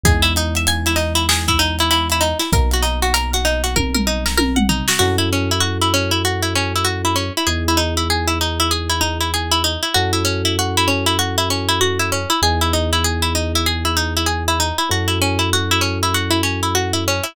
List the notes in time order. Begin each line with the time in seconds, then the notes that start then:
0.03 E2 G#3 B3 D#4 E4 G#4, kick, closed hi-hat
0.22 E4, closed hi-hat
0.36 D#4, closed hi-hat
0.55 E5, closed hi-hat
0.67 G#5, closed hi-hat
0.86 E4, closed hi-hat
0.96 D#4, snare, closed hi-hat
1.15 E4, closed hi-hat
1.29 G#4, snare
1.48 E4, kick, closed hi-hat
1.59 D#4, closed hi-hat
1.79 E4, closed hi-hat
1.91 E4, closed hi-hat
2.10 E4, closed hi-hat
2.21 D#4, closed hi-hat
2.39 E4, snare, closed hi-hat
2.52 B1 F#3 A#3 B3 D#4 A#4, kick, closed hi-hat
2.71 F#4, closed hi-hat
2.82 D#4, closed hi-hat
3.02 F#4, closed hi-hat
3.14 A#4, closed hi-hat
3.33 F#4, closed hi-hat
3.45 D#4, closed hi-hat
3.64 F#4, closed hi-hat
3.76 A#4, kick, high tom
3.94 A#4, mid tom
4.07 D#4
4.26 A#4, snare
4.38 A#4, high tom
4.56 F#5, mid tom
4.69 D#4, floor tom
4.88 F#4, snare
4.99 F#2 C#4 E4 F#4 A4
5.18 E4
5.33 C#4
5.51 E4
5.60 F#4
5.81 E4
5.94 C#4
6.11 E4
6.25 F#4
6.42 E4
6.55 C#4
6.76 E4
6.85 F#4
7.05 E4
7.16 C#4
7.37 E4
7.47 E2 B3 D#4 E4 G#4
7.68 E4
7.77 D#4
7.97 E4
8.10 G#4
8.27 E4
8.41 D#4
8.60 E4
8.71 G#4
8.90 E4
9.01 D#4
9.20 E4
9.34 G#4
9.51 E4
9.64 D#4
9.83 E4
9.94 F#2 C#4 E4 F#4 A4
10.13 E4
10.25 C#4
10.45 E4
10.59 F#4
10.77 E4
10.88 C#4
11.06 E4
11.19 F#4
11.38 E4
11.50 C#4
11.69 E4
11.81 F#4
11.99 E4
12.12 C#4
12.30 E4
12.42 E2 B3 D#4 E4 G#4
12.61 E4
12.73 D#4
12.93 E4
13.04 G#4
13.22 E4
13.35 D#4
13.55 E4
13.66 G#4
13.85 E4
13.97 D#4
14.17 E4
14.26 G#4
14.48 E4
14.60 D#4
14.78 E4
14.89 F#2 C#4 E4 F#4 A4
15.08 E4
15.22 C#4
15.39 E4
15.53 F#4
15.71 E4
15.81 C#4
16.03 E4
16.14 F#4
16.31 E4
16.43 C#4
16.63 E4
16.75 F#4
16.93 E4
17.08 C#4
17.23 E4